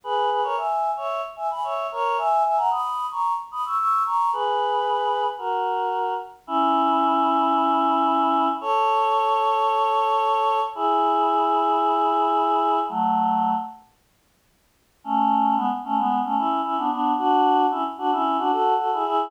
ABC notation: X:1
M:4/4
L:1/16
Q:1/4=112
K:G#m
V:1 name="Choir Aahs"
[GB]2 [GB] [Ac] [eg]3 [ce]2 z [eg] [gb] [ce]2 [Ac]2 | [eg]2 [eg] [fa] [bd']3 [ac']2 z [bd'] [c'e'] [c'e']2 [ac']2 | [GB]8 [FA]6 z2 | [K:C#m] [CE]16 |
[Ac]16 | [EG]16 | [F,A,]6 z10 | [K:F#m] [A,C]4 [G,B,] z [A,C] [G,B,]2 [A,C] [CE]2 [CE] [B,D] [B,D]2 |
[DF]4 [CE] z [DF] [CE]2 [DF] [FA]2 [FA] [EG] [EG]2 |]